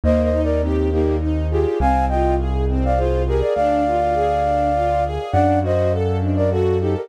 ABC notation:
X:1
M:3/4
L:1/16
Q:1/4=102
K:Eb
V:1 name="Flute"
(3[ce]2 [ce]2 [Bd]2 [CE]2 [EG]2 z2 [FA]2 | [fa]2 [eg]2 z3 [df] [Ac]2 [GB] [Bd] | [df]12 | [d^f]2 [ce]2 z3 [Bd] [^F=A]2 [EG] [GB] |]
V:2 name="String Ensemble 1"
B,2 E2 G2 B,2 E2 G2 | C2 F2 A2 C2 F2 A2 | D2 F2 A2 D2 F2 A2 | D2 ^F2 =A2 D2 F2 A2 |]
V:3 name="Acoustic Grand Piano" clef=bass
E,,12 | C,,12 | D,,12 | ^F,,12 |]